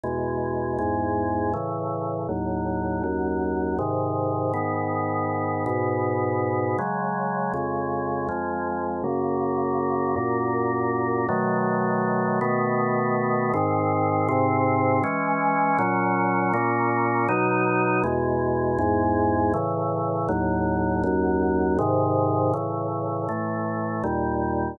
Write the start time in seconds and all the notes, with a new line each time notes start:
0.04 E2 B2 G#3
0.79 E2 G#2 G#3
1.54 A2 C#3 E3
2.29 D#2 A2 F#3
3.04 D#2 F#2 F#3
3.79 G#2 C3 D#3
4.54 G#2 D#3 B3
5.66 G#2 B2 B3
6.78 C#3 F#3 G#3
7.54 F2 C#3 G#3
8.29 F2 F3 G#3
9.04 F#2 C#3 A#3
10.16 F#2 A#2 A#3
11.29 B2 D#3 F#3 A3
12.41 B2 D#3 A3 B3
13.54 G#2 D#3 C4
14.29 G#2 C3 C4
15.04 E3 G#3 C#4
15.79 A#2 F#3 C#4
16.54 A#2 A#3 C#4
17.29 B2 F#3 D#4
18.04 E2 B2 G#3
18.79 E2 G#2 G#3
19.54 A2 C#3 E3
20.29 D#2 A2 F#3
21.04 D#2 F#2 F#3
21.79 G#2 C3 D#3
22.54 A2 C#3 E3
23.29 A2 E3 A3
24.04 D#2 A#2 G3